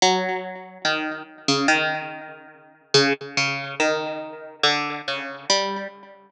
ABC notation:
X:1
M:7/8
L:1/16
Q:1/4=71
K:none
V:1 name="Pizzicato Strings" clef=bass
_G,4 _E,2 z _D, E,6 | _D, z D,2 _E,4 =D,2 _D,2 G,2 |]